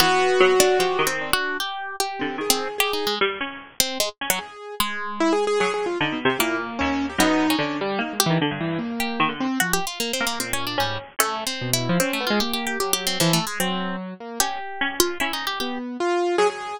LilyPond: <<
  \new Staff \with { instrumentName = "Orchestral Harp" } { \time 6/4 \tempo 4 = 150 b4. d'8 \tuplet 3/2 { g'4 c'4 ges'4 } g'4 g'4 | r16 c'8 r16 \tuplet 3/2 { g'8 ees'8 aes8 } r4. c'8 aes16 r8 ges16 r4 | aes1 bes2 | b8. des'8. r4 g'8 r4. g'4 r8 |
\tuplet 3/2 { ges'8 g'8 f'8 bes8 c'8 bes8 c'8 des'8 d'8 } g8 r8 \tuplet 3/2 { a4 c'4 e'4 } | \tuplet 3/2 { c'8 a8 f'8 g'8 g'8 g'8 g'8 g'8 c'8 f8 a8 aes8 } c'4 r4 | g'4. f'8 \tuplet 3/2 { e'8 ees'8 g'8 } g'8 r2 r8 | }
  \new Staff \with { instrumentName = "Harpsichord" } { \time 6/4 e4 ges4 f8 ees4 r2 d8 | ees2 g8 des'4. r8 des'4. | r2 ges4 \tuplet 3/2 { d8 b,8 c8 } bes,4 ees,4 | ges,4 d4 bes8. ees16 d16 g,4.~ g,16 ees16 d8 r16 |
r4. bes4. des'4 des'2 | r1. | des'8 r8 des'4 des'4. r4. ges4 | }
  \new Staff \with { instrumentName = "Acoustic Grand Piano" } { \time 6/4 ges'2. d'4 r4. c'8 | aes'4 aes'4 r2. aes'4 | r4 \tuplet 3/2 { e'8 aes'8 aes'8 aes'8 aes'8 f'8 } ees'8 r16 g'16 e'8 r8 des'8. g'16 | ees'4 d'8 g8 \tuplet 3/2 { ees'8 aes8 e8 } d8 e8 bes4. c'8 |
f8 r4. bes,4 aes,8 r4. b,8. f16 | des'8 b16 aes16 bes4 ges4 e8 r8 ges4. bes8 | r2. b4 f'4 aes'16 aes'8. | }
>>